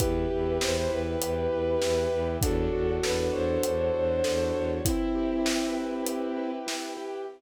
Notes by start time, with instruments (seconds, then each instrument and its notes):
0.00 violin E2 G4 B4, acoustic grand piano E4, choir aahs B4 E5 G5, kick, closed hi-hat
0.30 violin E2, acoustic grand piano G4
0.60 violin E2 C5, acoustic grand piano B4, snare
0.76 violin C5
0.90 violin E2 B4, acoustic grand piano E4
1.21 violin E2, acoustic grand piano G4, closed hi-hat
1.51 violin E2, acoustic grand piano B4
1.81 violin E2, acoustic grand piano E4, snare
2.11 violin E2, acoustic grand piano G4
2.41 violin E2 F#4 A4, acoustic grand piano D4, choir aahs A4 C#5 D5 F#5, kick, closed hi-hat
2.73 violin E2, acoustic grand piano F#4
3.03 violin E2 B4, acoustic grand piano A4, snare
3.18 violin B4
3.32 violin E2 C5, acoustic grand piano C#5
3.63 violin E2, acoustic grand piano D4, closed hi-hat
3.94 violin E2, acoustic grand piano F#4
4.24 violin E2, acoustic grand piano A4, snare
4.54 violin E2, acoustic grand piano C#5
4.85 violin C4 E4, acoustic grand piano E4, choir aahs B4 E5 G5, kick, closed hi-hat
5.15 acoustic grand piano G4
5.46 acoustic grand piano B4, snare
5.76 acoustic grand piano E4
6.06 acoustic grand piano G4, closed hi-hat
6.37 acoustic grand piano B4
6.67 acoustic grand piano E4, snare
6.97 acoustic grand piano G4